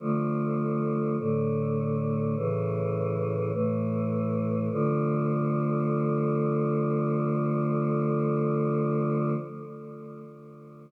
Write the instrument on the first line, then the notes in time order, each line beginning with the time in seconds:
choir aahs
0.00 D3 F3 A3
1.18 A2 D3 A3
2.36 A2 C#3 E3
3.52 A2 E3 A3
4.71 D3 F3 A3